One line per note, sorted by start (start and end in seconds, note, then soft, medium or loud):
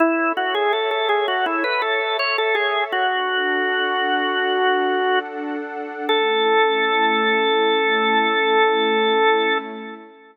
0.00 0.32 E4 medium
0.00 2.90 A4 medium
0.00 2.90 C#5 medium
0.00 2.90 E5 medium
0.37 0.54 F#4 medium
0.55 0.72 G#4 medium
0.73 0.90 A4 medium
0.91 1.08 A4 medium
1.09 1.26 G#4 medium
1.28 1.45 F#4 medium
1.46 1.63 E4 medium
1.64 1.81 B4 medium
1.82 2.17 A4 medium
2.19 2.37 C#5 medium
2.38 2.55 A4 medium
2.55 2.84 G#4 medium
2.92 6.06 D4 loud
2.92 5.19 F#4 medium
2.92 6.06 A4 loud
2.92 6.06 F#5 medium
6.09 9.59 A3 loud
6.09 9.59 C#4 medium
6.09 9.59 E4 loud
6.09 9.58 A4 loud